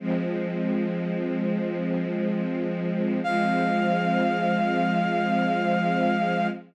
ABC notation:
X:1
M:4/4
L:1/8
Q:1/4=74
K:Fm
V:1 name="Brass Section"
z8 | f8 |]
V:2 name="String Ensemble 1"
[F,A,C]8 | [F,A,C]8 |]